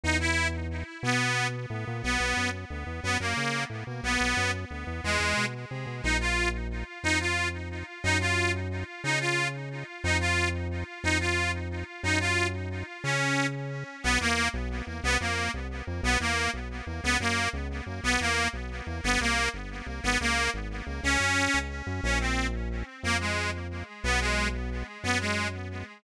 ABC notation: X:1
M:3/4
L:1/8
Q:1/4=180
K:G#m
V:1 name="Accordion"
D E2 z3 | B,3 z3 | [K:B] B,3 z3 | B, A,3 z2 |
B,3 z3 | G,3 z3 | [K:Bbm] E F2 z3 | E F2 z3 |
E F2 z3 | E F2 z3 | E F2 z3 | E F2 z3 |
E F2 z3 | D3 z3 | [K:B] B, A,2 z3 | _C _B,2 z3 |
B, A,2 z3 | B, A,2 z3 | B, A,2 z3 | _C _B,2 z3 |
B, A,2 z3 | C4 z2 | [K:Bbm] D C2 z3 | B, A,2 z3 |
_C A,2 z3 | _C A,2 z3 |]
V:2 name="Synth Bass 1" clef=bass
E,,6 | B,,4 =A,, ^A,, | [K:B] B,,, B,,, F,,2 =D,, E,, | F,, F,, C,2 =A,, B,, |
B,,, B,,, F,,2 =D,, E,, | E,, E,, B,,2 =C, B,, | [K:Bbm] B,,,6 | F,,6 |
G,,6 | D,6 | F,,6 | F,,6 |
G,,6 | D,6 | [K:B] B,,, E,,2 B,,,2 E,, | =C,, =F,,2 C,,2 F,, |
B,,, E,,2 B,,,2 E,, | C,, F,,2 C,,2 F,, | B,,, E,,2 B,,,2 E,, | =G,,, =C,,2 G,,,2 C,, |
G,,, C,,2 G,,,2 C,, | C,, F,,2 C,,2 F,, | [K:Bbm] B,,,6 | F,,6 |
_C,,6 | G,,6 |]